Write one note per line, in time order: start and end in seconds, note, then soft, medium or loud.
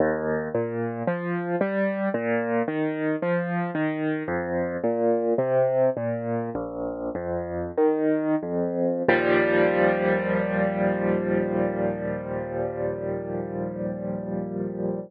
0.00 0.48 D#2 loud
0.55 1.03 A#2 medium
1.07 1.56 F3 medium
1.61 2.09 G3 medium
2.14 2.63 A#2 loud
2.68 3.16 D#3 medium
3.22 3.71 F3 medium
3.75 4.23 D#3 medium
4.28 4.77 F2 loud
4.84 5.34 A#2 medium
5.38 5.90 C3 medium
5.97 6.50 A#2 medium
6.55 7.10 A#1 loud
7.15 7.71 F2 medium
7.78 8.35 D#3 medium
8.43 9.03 F2 medium
9.09 15.00 D#2 loud
9.09 15.00 A#2 medium
9.09 15.00 F3 medium
9.09 15.00 G3 loud